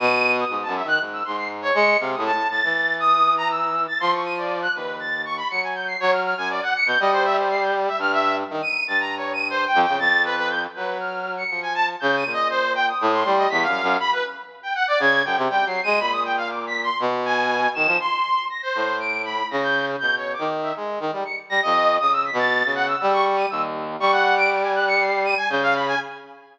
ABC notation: X:1
M:4/4
L:1/16
Q:1/4=120
K:none
V:1 name="Brass Section"
^d''3 ^d'2 a e ^f' z e' c' c'' z ^c ^c''2 | f ^d' a2 a'4 d'3 ^a e'3 =a' | c' ^c' ^d'' =d2 ^f' B2 a'2 c' b ^c'' ^g =g' =c'' | ^c f' f' ^g d ^f ^c'' =g' ^d =c e c =c'' g' z e |
f' e2 z2 ^d''2 a' (3^a2 ^c2 d''2 (3=c2 g2 g2 | a'2 B B g' z B2 f'3 ^c''2 ^g a z | (3g'2 ^d''2 ^d2 c2 g ^d'2 c'2 d b' f3 | b B z3 g ^f d ^g'2 =g z (3g2 c''2 ^d''2 |
b ^d' g f (3=d'2 b'2 c'2 z2 ^g4 e''2 | c'4 ^a' c3 d''2 b2 a' g'2 z | (3g'2 ^c2 d'2 z e z4 ^c'' z ^a' ^d3 | ^d' e' b' a'3 ^f e' e' ^c' c' ^d'' e' z3 |
^c' ^f2 d'' d'' ^g ^f' ^c'' =c''2 ^d'' g =g' =f b ^g |]
V:2 name="Brass Section" clef=bass
B,,4 (3^G,,2 ^F,,2 ^D,2 G,,2 G,,4 ^G,2 | (3C,2 A,,2 A,,2 A,, E,11 | F,6 ^D,,6 ^F,4 | ^F,3 ^F,,2 z2 B,, G,8 |
G,,4 ^D, z2 G,,7 F,, ^C, | F,,6 ^F,6 =F,4 | ^C,2 ^A,,6 =A,,2 G,2 (3E,,2 ^F,,2 F,,2 | z8 ^C,2 ^F,, =C, (3G,2 ^F,2 ^G,2 |
^A,,8 B,,6 ^D, F, | z6 A,,6 ^C,4 | B,,3 ^D,3 ^G,2 D, =G, z2 G, F,,3 | (3^C,4 B,,4 C,4 G,4 ^D,,4 |
G,12 ^C,4 |]